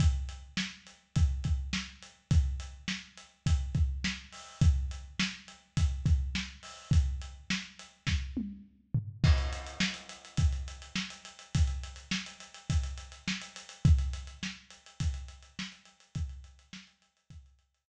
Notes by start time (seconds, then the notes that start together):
0.00 kick, closed hi-hat
0.29 closed hi-hat
0.57 snare
0.87 closed hi-hat
1.16 kick, closed hi-hat
1.44 kick, closed hi-hat
1.73 snare
2.03 closed hi-hat
2.31 kick, closed hi-hat
2.60 closed hi-hat
2.88 snare
3.17 closed hi-hat
3.46 kick, closed hi-hat
3.75 kick, closed hi-hat
4.04 snare
4.32 open hi-hat
4.61 kick, closed hi-hat
4.91 closed hi-hat
5.19 snare
5.48 closed hi-hat
5.77 kick, closed hi-hat
6.06 kick, closed hi-hat
6.35 snare
6.63 open hi-hat
6.91 kick, closed hi-hat
7.22 closed hi-hat
7.50 snare
7.79 closed hi-hat
8.07 kick, snare
8.37 high tom
8.94 floor tom
9.24 kick, crash
9.38 closed hi-hat
9.53 closed hi-hat
9.66 closed hi-hat
9.80 snare
9.94 closed hi-hat
10.09 closed hi-hat
10.25 closed hi-hat
10.37 kick, closed hi-hat
10.53 closed hi-hat
10.68 closed hi-hat
10.82 closed hi-hat
10.96 snare
11.10 closed hi-hat
11.25 closed hi-hat
11.39 closed hi-hat
11.55 kick, closed hi-hat
11.67 closed hi-hat
11.83 closed hi-hat
11.96 closed hi-hat
12.11 snare
12.26 closed hi-hat
12.40 closed hi-hat
12.54 closed hi-hat
12.70 kick, closed hi-hat
12.83 closed hi-hat
12.98 closed hi-hat
13.12 closed hi-hat
13.28 snare
13.41 closed hi-hat
13.56 closed hi-hat
13.69 closed hi-hat
13.85 kick, closed hi-hat
13.98 closed hi-hat
14.13 closed hi-hat
14.27 closed hi-hat
14.43 snare
14.70 closed hi-hat
14.86 closed hi-hat
15.00 kick, closed hi-hat
15.14 closed hi-hat
15.28 closed hi-hat
15.43 closed hi-hat
15.59 snare
15.72 closed hi-hat
15.85 closed hi-hat
16.00 closed hi-hat
16.15 kick, closed hi-hat
16.29 closed hi-hat
16.44 closed hi-hat
16.59 closed hi-hat
16.73 snare
16.87 closed hi-hat
17.02 closed hi-hat
17.17 closed hi-hat
17.30 kick, closed hi-hat
17.46 closed hi-hat
17.59 closed hi-hat
17.75 closed hi-hat